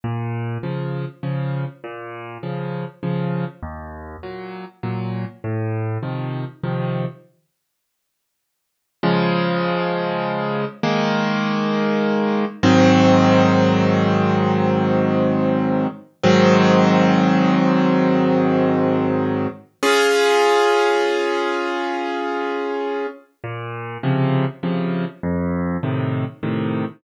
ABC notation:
X:1
M:3/4
L:1/8
Q:1/4=100
K:Bbm
V:1 name="Acoustic Grand Piano"
B,,2 [D,F,]2 [D,F,]2 | B,,2 [D,F,]2 [D,F,]2 | E,,2 [B,,G,]2 [B,,G,]2 | =A,,2 [C,E,F,]2 [C,E,F,]2 |
z6 | [K:Db] [D,F,A,]6 | [E,A,B,]6 | [A,,E,G,C]6- |
[A,,E,G,C]6 | [A,,E,G,C]6- | [A,,E,G,C]6 | [DFA]6- |
[DFA]6 | [K:Bbm] B,,2 [C,D,F,]2 [C,D,F,]2 | F,,2 [=A,,C,E,]2 [A,,C,E,]2 |]